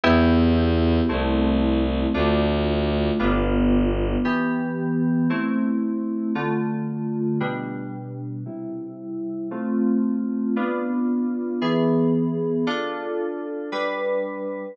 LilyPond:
<<
  \new Staff \with { instrumentName = "Electric Piano 2" } { \time 4/4 \key c \major \tempo 4 = 114 <b e' g'>2 <a c' e'>2 | <a d' f'>2 <g b d' f'>2 | \key a \minor <e b g'>2 <a c' e'>2 | <d a f'>2 <b, g d'>2 |
<c g e'>2 <a c' f'>2 | <b d' f'>2 <e b gis'>2 | <d' f' a'>2 <g d' b'>2 | }
  \new Staff \with { instrumentName = "Violin" } { \clef bass \time 4/4 \key c \major e,2 c,2 | d,2 g,,2 | \key a \minor r1 | r1 |
r1 | r1 | r1 | }
>>